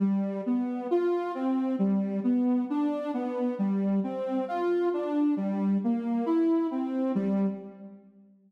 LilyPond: \new Staff { \time 2/4 \key g \mixolydian \tempo 4 = 67 g8 b8 f'8 c'8 | g8 b8 d'8 b8 | g8 c'8 f'8 d'8 | g8 bes8 e'8 c'8 |
g4 r4 | }